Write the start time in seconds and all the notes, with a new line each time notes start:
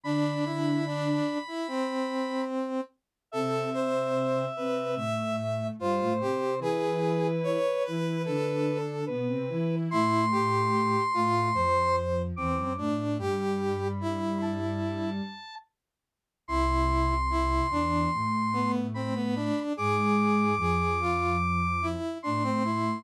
0.04 D3 D4 B5
0.46 E4
0.87 D4
1.48 E4
1.68 C4
3.32 C3 C4 A4 E5
3.74 C5
4.57 C3 C4 B4
4.96 A2 A3 E5
5.79 G2 G3 F4 C5
6.01 A2 A3
6.21 C3 C4 G4
6.59 E3 E4 G#4 B4
7.44 C#5
7.85 E3 E4 B4
8.26 D3 D4 A4
9.07 B2 B3 B4
9.28 C3 C4
9.49 E3 E4
9.90 A2 A3 E4 C6
10.31 G4
11.14 A2 A3 F4
11.54 F2 F3 C5
12.36 E2 E3 C4 D6
12.57 F#2 F#3
12.78 A2 A3 D4
13.18 G2 G3 G4 B5
14.01 E4
14.42 A5
16.48 C2 C3 E4 C6
17.30 E4
17.70 E2 E3 D4
18.14 A2 A3
18.53 B3
18.94 C4 B5
19.15 B3
19.36 D4
19.77 G#2 G#3 G#4 D6
20.57 F2 F3 G#4
21.00 F4
21.82 E4
22.23 A2 A3 D4 C6
22.44 C4
22.65 E4